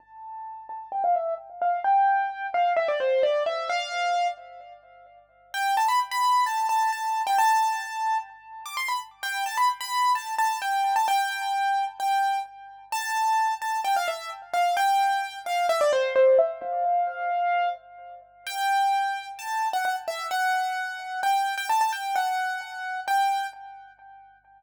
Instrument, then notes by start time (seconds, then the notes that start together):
acoustic grand piano
0.00 A5
0.69 A5
0.92 G5
1.04 F5
1.15 E5
1.62 F5
1.84 G5
2.54 F5
2.77 E5
2.88 D5
3.00 C5
3.23 D5
3.46 E5
3.70 F5
5.54 G5
5.77 A5
5.88 B5
6.11 B5
6.46 A5
6.69 A5
6.92 A5
7.27 G5
7.38 A5
8.66 D6
8.77 C6
8.88 B5
9.23 G5
9.46 A5
9.57 B5
9.81 B5
10.15 A5
10.38 A5
10.62 G5
10.96 A5
11.08 G5
12.00 G5
12.92 A5
13.62 A5
13.84 G5
13.96 F5
14.08 E5
14.54 F5
14.77 G5
15.46 F5
15.69 E5
15.81 D5
15.93 C5
16.16 C5
16.39 E5
16.62 F5
18.47 G5
19.39 A5
19.73 F#5
19.85 F#5
20.08 E5
20.31 F#5
21.23 G5
21.57 G5
21.69 A5
21.81 A5
21.92 G5
22.15 F#5
23.08 G5